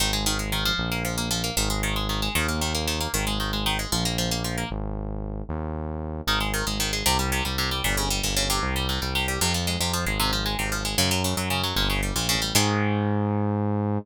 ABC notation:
X:1
M:12/8
L:1/16
Q:3/8=153
K:Ab
V:1 name="Acoustic Guitar (steel)"
E,2 A,2 E,2 A,2 E,2 F,4 B,2 F,2 B,2 F,2 B,2 | E,2 A,2 E,2 A,2 E,2 A,2 E,2 B,2 E,2 B,2 E,2 B,2 | E,2 A,2 E,2 A,2 E,2 A,2 F,2 B,2 F,2 B,2 F,2 B,2 | z24 |
E,2 A,2 E,2 A,2 E,2 A,2 C,2 G,2 C,2 G,2 C,2 G,2 | B,,2 D,2 G,2 B,,2 D,2 C,4 G,2 C,2 G,2 C,2 G,2 | C,2 F,2 A,2 C,2 F,2 A,2 C,2 F,2 A,2 C,2 F,2 A,2 | D,2 _G,2 D,2 G,2 D,2 G,2 B,,2 D,2 =G,2 B,,2 D,2 G,2 |
[E,A,]24 |]
V:2 name="Synth Bass 1" clef=bass
A,,,12 B,,,12 | A,,,12 E,,12 | A,,,12 B,,,12 | A,,,12 E,,12 |
A,,,6 A,,,6 C,,6 C,,6 | G,,,6 G,,,6 C,,6 C,,6 | F,,6 F,,4 A,,,8 A,,,6 | _G,,6 G,,6 =G,,,6 B,,,3 =A,,,3 |
A,,24 |]